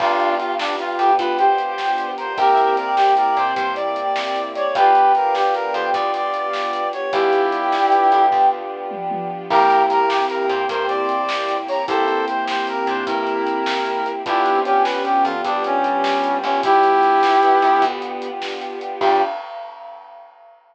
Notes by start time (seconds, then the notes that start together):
0.00 G1 B3 D4 F4 G4 B4 D5 F5 G5, kick, crash
0.20 closed hi-hat
0.38 F4, closed hi-hat
0.59 D4, snare
0.79 F4, closed hi-hat
0.98 F2 G4, closed hi-hat
1.19 D2 F4 B4, kick, closed hi-hat
1.39 G4 C5, closed hi-hat
1.58 closed hi-hat
1.78 snare
1.98 closed hi-hat
2.17 A#4 C5, closed hi-hat
2.37 C2 A#3 C4 E4 G4 A#4 C5 E5 G5, kick, closed hi-hat
2.57 closed hi-hat
2.77 A#4 D5, closed hi-hat
2.96 G4, snare
3.17 A#4 D5, closed hi-hat
3.37 A#2 C5, closed hi-hat
3.56 G2 C5, kick, closed hi-hat
3.75 D5, closed hi-hat
3.96 closed hi-hat
4.16 snare
4.36 closed hi-hat
4.55 C#5 D5, closed hi-hat
4.75 G1 B3 D4 F4 G4 B4 D5 F5 G5, kick, closed hi-hat
4.95 closed hi-hat
5.15 A#4, closed hi-hat
5.35 G4, snare
5.54 A#4, closed hi-hat
5.74 F2 G4 C5, closed hi-hat
5.93 D2 F4 D5, kick, closed hi-hat
6.14 D5, closed hi-hat
6.34 closed hi-hat
6.53 snare
6.73 closed hi-hat
6.93 C#5, closed hi-hat
7.12 G1 B3 D4 E4 F4 G4 B4 D5 F5 G5, kick, closed hi-hat
7.33 closed hi-hat
7.52 closed hi-hat
7.72 snare
7.92 closed hi-hat
8.12 F2, closed hi-hat
8.32 D2, kick, floor tom
8.91 high tom
9.11 high tom
9.50 C2 A#3 C4 E4 G4 A#4, kick, crash
9.70 closed hi-hat
9.90 A#4, closed hi-hat
10.09 G4, snare
10.30 A#4, closed hi-hat
10.48 A#2 C5, closed hi-hat
10.69 G2 A#4 C5, kick, closed hi-hat
10.88 C5 D5, closed hi-hat
11.09 closed hi-hat
11.29 snare
11.49 closed hi-hat
11.68 C#5 A#5, open hi-hat
11.88 C2 A#3 C4 E4 G4 A4 C5, kick, closed hi-hat
12.08 closed hi-hat
12.28 C5, closed hi-hat
12.48 C5, snare
12.67 A#4, closed hi-hat
12.87 A#2 D4 C5, closed hi-hat
13.07 G2 E4 A#4, kick, closed hi-hat
13.27 closed hi-hat
13.47 closed hi-hat
13.66 snare
13.86 closed hi-hat
14.06 closed hi-hat
14.26 G1 B3 D4 E4 F4 G4, kick, closed hi-hat
14.46 closed hi-hat
14.55 C4
14.65 C#4 G4, closed hi-hat
14.83 B4, snare
15.05 G4, closed hi-hat
15.25 F2 F4, closed hi-hat
15.44 D2 G3 D4, kick, closed hi-hat
15.64 C#4, closed hi-hat
15.84 closed hi-hat
16.04 snare
16.24 closed hi-hat
16.43 G1 C#4, closed hi-hat
16.63 G3 B3 D4 E4 F4 G4, kick, closed hi-hat
16.83 closed hi-hat
17.03 closed hi-hat
17.23 snare
17.43 B3, closed hi-hat
17.62 F2, closed hi-hat
17.82 D2, kick, closed hi-hat
18.02 closed hi-hat
18.22 closed hi-hat
18.42 snare
18.61 closed hi-hat
18.81 closed hi-hat
19.01 G2 G3 B3 D4 F4 G4, kick, crash